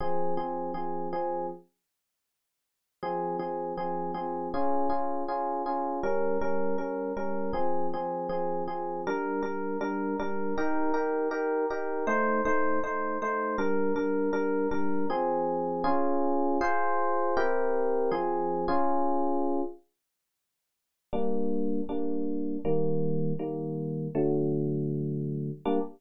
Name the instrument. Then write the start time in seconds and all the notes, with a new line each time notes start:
electric piano 1
0.00 F3 C4 G#4
0.37 F3 C4 G#4
0.74 F3 C4 G#4
1.13 F3 C4 G#4
3.03 F3 C4 G#4
3.39 F3 C4 G#4
3.77 F3 C4 G#4
4.14 F3 C4 G#4
4.54 C#4 F4 G#4
4.90 C#4 F4 G#4
5.28 C#4 F4 G#4
5.66 C#4 F4 G#4
6.03 G3 C#4 A#4
6.41 G3 C#4 A#4
6.78 G3 C#4 A#4
7.17 G3 C#4 A#4
7.53 F3 C4 G#4
7.94 F3 C4 G#4
8.29 F3 C4 G#4
8.68 F3 C4 G#4
9.07 G3 D4 A#4
9.43 G3 D4 A#4
9.81 G3 D4 A#4
10.19 G3 D4 A#4
10.58 D#4 G4 A#4
10.94 D#4 G4 A#4
11.31 D#4 G4 A#4
11.70 D#4 G4 A#4
12.07 A3 D#4 C5
12.45 A3 D#4 C5
12.84 A3 D#4 C5
13.22 A3 D#4 C5
13.58 G3 D4 A#4
13.96 G3 D4 A#4
14.33 G3 D4 A#4
14.71 G3 D4 A#4
15.10 F3 C4 G#4
15.84 C#4 F4 G#4
16.61 F4 G#4 C5
17.37 C4 E4 G4 A#4
18.11 F3 C4 G#4
18.68 C#4 F4 G#4
21.13 G3 A#3 D4
21.89 G3 A#3 D4
22.65 D#3 G3 A#3
23.39 D#3 G3 A#3
24.15 D3 F#3 A3
25.65 G3 A#3 D4